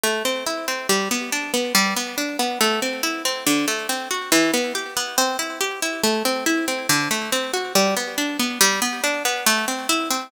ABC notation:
X:1
M:4/4
L:1/8
Q:1/4=140
K:G
V:1 name="Orchestral Harp"
A, C E C G, B, D B, | G, B, D B, A, C E C | D, A, C F E, B, G B, | C E G E A, C E C |
D, A, C F G, B, D B, | G, B, D B, A, C E C |]